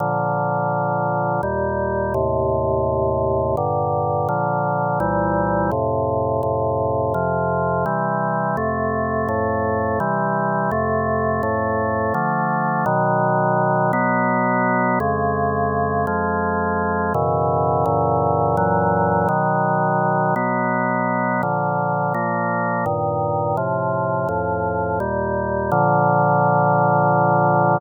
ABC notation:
X:1
M:3/4
L:1/8
Q:1/4=84
K:Bb
V:1 name="Drawbar Organ"
[B,,D,F,]4 [E,,B,,G,]2 | [E,,A,,C,]4 [G,,B,,D,]2 | [B,,D,F,]2 [C,,B,,=E,G,]2 [F,,A,,C,]2 | [F,,A,,C,]2 [F,,C,F,]2 [C,=E,G,]2 |
[F,,C,A,]2 [F,,A,,A,]2 [C,=E,G,]2 | [F,,C,A,]2 [F,,A,,A,]2 [D,F,A,]2 | [K:B] [B,,D,F,]3 [B,,F,B,]3 | [^E,,C,G,]3 [E,,^E,G,]3 |
[F,,B,,C,E,]2 [F,,A,,C,E,]2 [F,,A,,E,F,]2 | [B,,D,F,]3 [B,,F,B,]3 | [K:Bb] [B,,D,F,]2 [B,,F,B,]2 [G,,B,,E,]2 | [A,,C,F,]2 [F,,A,,F,]2 [E,,B,,G,]2 |
[B,,D,F,]6 |]